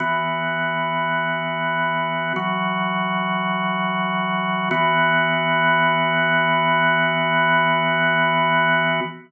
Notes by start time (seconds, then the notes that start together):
0.00 E3 B3 F#4
2.36 E3 F#3 F#4
4.71 E3 B3 F#4